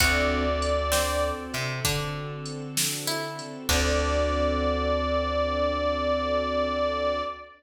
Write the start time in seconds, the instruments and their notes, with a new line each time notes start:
0.00 electric bass (finger) D2, string ensemble 1 C4 D4 F#4 A4, acoustic grand piano C4 D4 F#4 A4, pizzicato strings F#4, harmonica D5, kick, closed hi-hat
0.62 closed hi-hat
0.92 pizzicato strings C4, snare
1.54 electric bass (finger) C3, closed hi-hat
1.85 electric bass (finger) D3, pizzicato strings D4, kick, closed hi-hat
2.46 closed hi-hat
2.77 snare
3.07 pizzicato strings E4
3.39 closed hi-hat
3.69 electric bass (finger) D2, string ensemble 1 C4 D4 F#4 A4, acoustic grand piano C4 D4 F#4 A4, pizzicato strings D4, harmonica D5, kick, crash